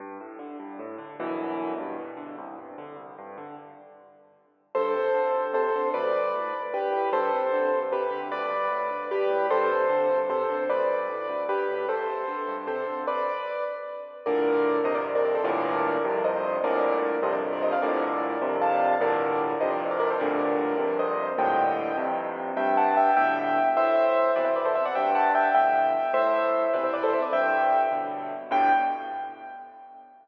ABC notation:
X:1
M:6/8
L:1/16
Q:3/8=101
K:G
V:1 name="Acoustic Grand Piano"
z12 | z12 | z12 | z12 |
[Ac]8 [Ac]4 | [Bd]8 [GB]4 | [Ac]8 [GB]4 | [Bd]8 [GB]4 |
[Ac]8 [Ac]4 | [Bd]8 [GB]4 | [Ac]8 [Ac]4 | [Bd]6 z6 |
[K:Gm] [Bd]6 [ce] [Bd] z [Bd] [Bd] [Ac] | [Bd]8 [ce]4 | [Bd]6 [ce] [Bd] z [Bd] [ce] [df] | [Bd]8 [fa]4 |
[Bd]6 [ce] [Bd] z [Bd] [Bd] [Ac] | [Bd]8 [ce]4 | [eg]6 z6 | [K:G] [eg]2 [fa]2 [eg]2 [eg]6 |
[ce]6 [Bd] [ce] [Bd] [Ac] [ce] [df] | [eg]2 [fa]2 [eg]2 [eg]6 | [ce]6 [Bd] [ce] [Bd] [Ac] [ce] [Bd] | [eg]6 z6 |
g6 z6 |]
V:2 name="Acoustic Grand Piano" clef=bass
G,,2 A,,2 D,2 G,,2 A,,2 D,2 | [G,,,F,,B,,E,]6 G,,2 B,,2 D,2 | C,,2 G,,2 D,2 C,,2 G,,2 D,2 | z12 |
G,,2 C,2 D,2 G,,2 C,2 D,2 | D,,2 G,,2 A,,2 D,,2 G,,2 A,,2 | G,,2 C,2 D,2 G,,2 C,2 D,2 | D,,2 G,,2 A,,2 D,,2 G,,2 A,,2 |
G,,2 C,2 D,2 G,,2 C,2 D,2 | D,,2 G,,2 A,,2 D,,2 G,,2 A,,2 | G,,2 C,2 D,2 G,,2 C,2 D,2 | z12 |
[K:Gm] [G,,A,,B,,D,]6 [F,,G,,C,]6 | [G,,A,,B,,D,]6 [F,,G,,C,]6 | [G,,A,,B,,D,]6 [F,,G,,C,]6 | [G,,A,,B,,D,]6 [F,,G,,C,]6 |
[G,,A,,B,,D,]6 [F,,G,,C,]6 | [G,,A,,B,,D,]6 [F,,G,,C,]6 | [G,,A,,B,,D,]6 [F,,G,,C,]6 | [K:G] G,,6 [A,,B,,D,]6 |
A,,6 [B,,C,E,]6 | G,,6 [A,,B,,D,]6 | A,,6 [B,,C,E,]6 | G,,6 [A,,B,,D,]6 |
[G,,A,,B,,D,]6 z6 |]